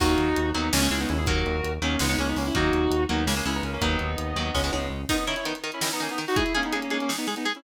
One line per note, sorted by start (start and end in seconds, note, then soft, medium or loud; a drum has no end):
0.00 0.16 D#2 loud
0.00 0.29 D#3 loud
0.00 0.29 F#3 loud
0.00 0.29 A#3 loud
0.00 0.50 D#4 medium
0.00 0.50 F#4 medium
0.00 kick loud
0.00 crash loud
0.18 0.34 D#2 medium
0.18 closed hi-hat medium
0.36 0.52 D#2 medium
0.36 closed hi-hat loud
0.54 0.70 D#2 medium
0.54 0.69 D#3 medium
0.54 0.69 F#3 loud
0.54 0.69 A#3 medium
0.54 0.72 B3 medium
0.54 0.72 D#4 medium
0.54 closed hi-hat medium
0.72 0.88 C#2 loud
0.72 0.80 C#3 loud
0.72 0.80 G#3 loud
0.72 0.81 A#3 medium
0.72 0.81 C#4 medium
0.72 snare loud
0.81 0.89 C#3 loud
0.81 0.89 G#3 loud
0.81 0.90 A#3 medium
0.81 0.90 C#4 medium
0.90 1.06 C#2 medium
0.90 1.20 C#3 medium
0.90 1.20 G#3 medium
0.90 0.99 C#4 medium
0.90 0.99 E4 medium
0.90 closed hi-hat medium
1.00 1.08 B3 medium
1.00 1.08 D#4 medium
1.09 1.43 D#2 loud
1.09 1.17 C#4 medium
1.09 1.17 E4 medium
1.09 closed hi-hat medium
1.18 1.26 E4 medium
1.18 1.26 G#4 medium
1.26 1.56 D#3 loud
1.26 1.56 F#3 loud
1.26 1.56 A#3 medium
1.26 1.72 F#4 medium
1.26 1.72 A#4 medium
1.26 kick loud
1.26 closed hi-hat loud
1.46 1.61 D#2 medium
1.46 closed hi-hat medium
1.64 1.79 D#2 medium
1.64 closed hi-hat medium
1.81 1.97 D#2 medium
1.81 1.96 D#3 medium
1.81 1.96 F#3 medium
1.81 1.96 A#3 medium
1.81 1.99 A#3 medium
1.81 1.99 C#4 medium
1.81 closed hi-hat medium
1.99 2.16 C#2 loud
1.99 2.07 C#3 loud
1.99 2.07 G#3 loud
1.99 2.09 B3 medium
1.99 2.09 D#4 medium
1.99 snare loud
2.09 2.16 C#3 loud
2.09 2.16 G#3 medium
2.09 2.18 B3 medium
2.09 2.18 D#4 medium
2.18 2.34 C#2 medium
2.18 2.47 C#3 medium
2.18 2.47 G#3 medium
2.18 2.28 A#3 medium
2.18 2.28 C#4 medium
2.18 closed hi-hat medium
2.28 2.37 B3 medium
2.28 2.37 D#4 medium
2.36 2.51 C#2 medium
2.36 2.46 A#3 medium
2.36 2.46 C#4 medium
2.36 open hi-hat medium
2.46 2.55 C#4 medium
2.46 2.55 E4 medium
2.54 2.70 D#2 medium
2.54 2.84 D#3 loud
2.54 2.84 F#3 loud
2.54 2.84 A#3 loud
2.54 3.03 D#4 medium
2.54 3.03 F#4 medium
2.54 kick loud
2.54 closed hi-hat loud
2.72 2.88 D#2 medium
2.72 closed hi-hat medium
2.90 3.06 D#2 medium
2.90 closed hi-hat loud
3.09 3.25 D#2 medium
3.09 3.24 D#3 medium
3.09 3.24 F#3 medium
3.09 3.24 A#3 medium
3.09 3.25 B3 medium
3.09 3.25 D#4 medium
3.09 closed hi-hat medium
3.26 3.42 C#2 medium
3.26 3.34 C#3 loud
3.26 3.34 G#3 loud
3.26 3.35 A#3 medium
3.26 3.35 C#4 medium
3.26 snare loud
3.36 3.44 C#3 medium
3.36 3.44 G#3 medium
3.36 3.45 A#3 medium
3.36 3.45 C#4 medium
3.45 3.61 C#2 medium
3.45 3.75 C#3 medium
3.45 3.75 G#3 medium
3.45 3.54 C#4 medium
3.45 3.54 E4 medium
3.45 closed hi-hat medium
3.55 3.63 B3 medium
3.55 3.63 D#4 medium
3.63 3.78 C#2 medium
3.63 3.73 A#3 medium
3.63 3.73 C#4 medium
3.63 closed hi-hat medium
3.73 3.82 A#3 medium
3.73 3.82 C#4 medium
3.81 3.97 D#2 loud
3.81 4.11 D#3 loud
3.81 4.11 F#3 loud
3.81 4.11 A#3 loud
3.81 4.86 B3 medium
3.81 4.86 D#4 medium
3.81 kick medium
3.81 closed hi-hat loud
3.99 4.16 D#2 medium
3.99 closed hi-hat medium
4.18 4.34 D#2 medium
4.18 closed hi-hat loud
4.36 4.51 D#2 medium
4.36 4.51 D#3 medium
4.36 4.51 F#3 medium
4.36 4.51 A#3 medium
4.36 closed hi-hat medium
4.55 4.70 C#2 loud
4.55 4.62 C#3 loud
4.55 4.62 G#3 loud
4.55 kick medium
4.55 snare medium
4.64 4.71 C#3 loud
4.64 4.71 G#3 medium
4.72 4.89 C#2 medium
4.72 5.02 C#3 medium
4.72 5.02 G#3 medium
4.72 high tom medium
4.90 5.06 C#2 medium
5.09 5.16 D#3 loud
5.09 5.25 B3 medium
5.09 5.16 D#4 medium
5.09 5.25 D#4 medium
5.09 5.16 A#4 loud
5.09 kick loud
5.09 crash loud
5.18 closed hi-hat medium
5.27 5.35 D#3 medium
5.27 5.35 C#4 medium
5.27 5.35 D#4 loud
5.27 5.35 E4 medium
5.27 5.35 A#4 medium
5.27 closed hi-hat medium
5.36 5.45 C#4 medium
5.36 5.45 E4 medium
5.36 closed hi-hat medium
5.45 5.53 D#3 medium
5.45 5.54 B3 medium
5.45 5.54 D#4 medium
5.45 5.53 D#4 medium
5.45 5.53 A#4 medium
5.45 closed hi-hat loud
5.55 closed hi-hat medium
5.64 5.71 D#3 medium
5.64 5.71 D#4 medium
5.64 5.71 A#4 medium
5.64 closed hi-hat medium
5.72 5.82 C#4 medium
5.72 5.82 E4 medium
5.72 closed hi-hat medium
5.81 5.89 D#3 medium
5.81 5.91 C#4 medium
5.81 5.89 D#4 medium
5.81 5.91 E4 medium
5.81 5.89 A#4 medium
5.81 snare loud
5.91 6.01 B3 medium
5.91 6.01 D#4 medium
5.91 closed hi-hat medium
6.00 6.07 D#3 medium
6.00 6.10 A#3 medium
6.00 6.10 C#4 medium
6.00 6.07 D#4 medium
6.00 6.07 A#4 medium
6.00 closed hi-hat medium
6.09 6.19 B3 medium
6.09 6.19 D#4 medium
6.09 closed hi-hat medium
6.18 6.25 D#3 medium
6.18 6.25 D#4 medium
6.18 6.25 A#4 medium
6.18 closed hi-hat medium
6.28 6.36 D#4 medium
6.28 6.36 F#4 medium
6.28 open hi-hat medium
6.36 6.43 G#3 loud
6.36 6.43 D#4 loud
6.36 6.53 E4 medium
6.36 6.43 G#4 loud
6.36 6.53 G#4 medium
6.36 kick loud
6.36 closed hi-hat loud
6.46 closed hi-hat medium
6.54 6.62 G#3 medium
6.54 6.64 A#3 medium
6.54 6.64 C#4 medium
6.54 6.62 D#4 medium
6.54 6.62 G#4 loud
6.54 closed hi-hat medium
6.63 6.73 B3 medium
6.63 6.73 D#4 medium
6.63 closed hi-hat medium
6.72 6.80 G#3 loud
6.72 6.83 A#3 medium
6.72 6.83 C#4 medium
6.72 6.80 D#4 medium
6.72 6.80 G#4 medium
6.72 closed hi-hat loud
6.82 6.92 A#3 medium
6.82 6.92 C#4 medium
6.82 closed hi-hat medium
6.90 6.98 G#3 medium
6.90 7.01 A#3 medium
6.90 7.01 C#4 medium
6.90 6.98 D#4 medium
6.90 6.98 G#4 medium
6.90 closed hi-hat medium
7.00 7.10 A#3 medium
7.00 7.10 C#4 medium
7.00 closed hi-hat medium
7.09 7.16 G#3 medium
7.09 7.16 D#4 medium
7.09 7.16 G#4 medium
7.09 snare loud
7.18 7.26 B3 medium
7.18 7.26 D#4 medium
7.18 closed hi-hat medium
7.27 7.35 G#3 medium
7.27 7.35 D#4 medium
7.27 7.35 G#4 medium
7.27 closed hi-hat medium
7.36 7.45 B3 medium
7.36 7.45 D#4 medium
7.36 closed hi-hat medium
7.45 7.53 G#3 medium
7.45 7.53 D#4 medium
7.45 7.53 G#4 loud
7.45 closed hi-hat medium
7.55 7.63 C#4 medium
7.55 7.63 E4 medium
7.55 closed hi-hat medium